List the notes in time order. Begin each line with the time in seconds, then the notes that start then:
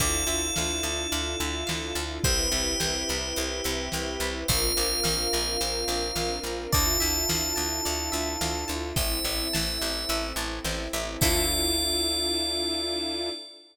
0.00 D2 D4 E4 F4 A4 D5, kick, closed hi-hat
0.27 D2 E5
0.56 D2 F5, snare
0.83 D2 A5
1.12 D2 D5, closed hi-hat
1.40 D2 E5
1.67 D2 F5, snare
1.95 D2 A5
2.24 C2 C4 E4 G4 B4 C5, kick, closed hi-hat
2.52 C2 E5
2.80 C2 G5, snare
3.09 C2 B5
3.36 C2 C5, closed hi-hat
3.64 C2 E5
3.92 C2 G5, snare
4.20 C2 B5
4.48 A#1 C4 D4 F4 A#4 C5 F5, kick, closed hi-hat
4.77 A#1 D5
5.04 A#1 F5, snare
5.33 A#1 A#5
5.61 A#1 C5, closed hi-hat
5.88 A#1 D5
6.16 A#1 F5, snare
6.43 A#1 A#5
6.72 D2 D4 E4 F4 A4 D5 A5, kick, closed hi-hat
7.00 D2 E5
7.29 D2 F5, snare
7.56 D2 A5
7.85 D2 D5, closed hi-hat
8.12 D2 E5
8.41 D2 F5, snare
8.68 D2 A5
8.96 A1 C4 E4 A4 C5 E5, kick, closed hi-hat
9.24 A1 E5
9.53 A1 A5, snare
9.81 A1 C5
10.09 A1 E5, closed hi-hat
10.36 A1 A5
10.64 A1 C5, snare
10.93 A1 E5
11.21 D2 D4 E4 F4 A4 D5, kick, crash